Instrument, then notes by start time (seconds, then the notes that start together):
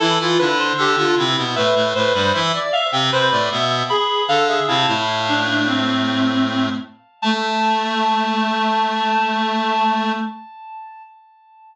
clarinet
0.00 E3 E4 A4
0.19 E3 E4 F4
0.39 D3 D4 E4 B4
0.58 C5
0.77 D3 D4 G4 A4
0.97 D3 D4 F4
1.16 C3 C4 E4
1.37 B2 B3
1.56 A2 A3 B4 E5
1.75 A2 A3
1.95 A2 A3 B4 C5
2.14 G2 G3 B4 C5
2.34 E3 E4 E5
2.53 D5
2.72 E5 F5
2.92 C3 C4 G5
3.12 C3 C4 B4 C5
3.31 A2 A3 D5
3.50 B2 B3 E5
3.90 G#4 B5
4.28 D3 D4 A4 F5
4.48 G#4 E5
4.67 C3 C4 E4 F5 A5
4.86 A2 A3 E4
5.29 D4
5.48 D4
5.66 C4
7.22 A3 A5